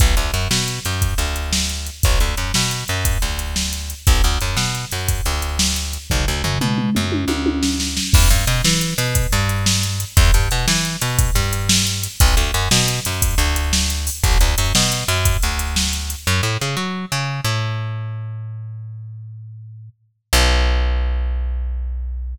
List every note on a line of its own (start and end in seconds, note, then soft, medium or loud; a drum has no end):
0.00 0.15 B1 medium
0.00 kick loud
0.00 closed hi-hat loud
0.17 0.31 D2 medium
0.17 closed hi-hat medium
0.34 0.48 F#2 medium
0.34 closed hi-hat medium
0.51 0.80 B2 medium
0.51 snare loud
0.68 closed hi-hat medium
0.85 1.14 F#2 medium
0.85 closed hi-hat medium
1.02 kick medium
1.02 closed hi-hat medium
1.18 1.90 D2 medium
1.18 closed hi-hat medium
1.36 closed hi-hat medium
1.53 snare loud
1.69 closed hi-hat medium
1.87 closed hi-hat medium
2.03 2.19 B1 medium
2.03 kick loud
2.03 closed hi-hat loud
2.20 2.35 D2 medium
2.20 closed hi-hat medium
2.37 2.52 F#2 medium
2.37 closed hi-hat medium
2.54 2.84 B2 medium
2.54 snare loud
2.71 closed hi-hat medium
2.88 3.18 F#2 medium
2.88 closed hi-hat medium
3.05 kick medium
3.05 closed hi-hat loud
3.22 3.94 D2 medium
3.22 closed hi-hat medium
3.39 closed hi-hat medium
3.56 snare loud
3.73 closed hi-hat medium
3.90 closed hi-hat medium
4.07 4.22 B1 medium
4.07 kick loud
4.07 closed hi-hat loud
4.24 4.38 D2 medium
4.24 closed hi-hat medium
4.41 4.56 F#2 medium
4.41 closed hi-hat medium
4.57 4.85 B2 medium
4.57 snare loud
4.75 closed hi-hat medium
4.91 5.21 F#2 medium
4.91 closed hi-hat medium
5.08 kick medium
5.08 closed hi-hat loud
5.25 5.98 D2 medium
5.25 closed hi-hat medium
5.42 closed hi-hat medium
5.59 snare loud
5.76 closed hi-hat medium
5.93 closed hi-hat medium
6.10 6.25 B1 medium
6.10 kick medium
6.10 floor tom medium
6.28 6.42 D2 medium
6.44 6.58 F#2 medium
6.44 floor tom medium
6.61 6.90 B2 medium
6.61 mid tom medium
6.78 mid tom medium
6.95 7.25 F#2 medium
6.95 mid tom medium
7.12 high tom medium
7.28 8.00 D2 medium
7.28 high tom medium
7.46 high tom loud
7.63 snare medium
7.80 snare medium
7.97 snare loud
8.13 8.29 E2 medium
8.13 kick loud
8.13 crash loud
8.30 8.45 G2 medium
8.30 closed hi-hat medium
8.47 8.62 B2 medium
8.47 closed hi-hat medium
8.64 8.94 E3 medium
8.64 snare loud
8.81 closed hi-hat medium
8.98 9.27 B2 medium
8.98 closed hi-hat medium
9.15 kick medium
9.15 closed hi-hat loud
9.32 10.05 G2 medium
9.32 closed hi-hat medium
9.49 closed hi-hat medium
9.66 snare loud
9.83 closed hi-hat medium
10.00 closed hi-hat medium
10.17 10.31 E2 loud
10.17 kick loud
10.17 closed hi-hat loud
10.34 10.49 G2 medium
10.34 closed hi-hat medium
10.51 10.66 B2 medium
10.51 closed hi-hat medium
10.68 10.96 E3 medium
10.68 snare loud
10.85 closed hi-hat medium
11.01 11.31 B2 medium
11.01 closed hi-hat loud
11.19 kick loud
11.19 closed hi-hat loud
11.35 12.07 G2 medium
11.35 closed hi-hat medium
11.53 closed hi-hat medium
11.69 snare loud
11.87 closed hi-hat medium
12.03 closed hi-hat loud
12.20 12.35 B1 medium
12.20 kick loud
12.20 closed hi-hat loud
12.37 12.51 D2 medium
12.37 closed hi-hat medium
12.54 12.69 F#2 medium
12.54 closed hi-hat medium
12.71 13.00 B2 medium
12.71 snare loud
12.88 closed hi-hat medium
13.05 13.35 F#2 medium
13.05 closed hi-hat loud
13.22 kick loud
13.22 closed hi-hat loud
13.38 14.10 D2 medium
13.38 closed hi-hat medium
13.56 closed hi-hat medium
13.73 snare loud
13.90 closed hi-hat medium
14.07 open hi-hat medium
14.24 14.38 B1 medium
14.24 kick loud
14.24 closed hi-hat loud
14.41 14.55 D2 medium
14.41 closed hi-hat medium
14.58 14.73 F#2 medium
14.58 closed hi-hat loud
14.75 15.04 B2 medium
14.75 snare loud
14.92 closed hi-hat medium
15.08 15.37 F#2 medium
15.08 closed hi-hat medium
15.25 kick medium
15.25 closed hi-hat loud
15.42 16.15 D2 medium
15.42 closed hi-hat medium
15.59 closed hi-hat medium
15.76 snare loud
15.93 closed hi-hat medium
16.10 closed hi-hat medium
16.27 16.41 F#2 medium
16.43 16.57 A2 medium
16.61 16.76 C#3 medium
16.77 17.05 F#3 medium
17.12 17.41 C#3 medium
17.44 19.89 A2 medium
20.33 22.35 B1 loud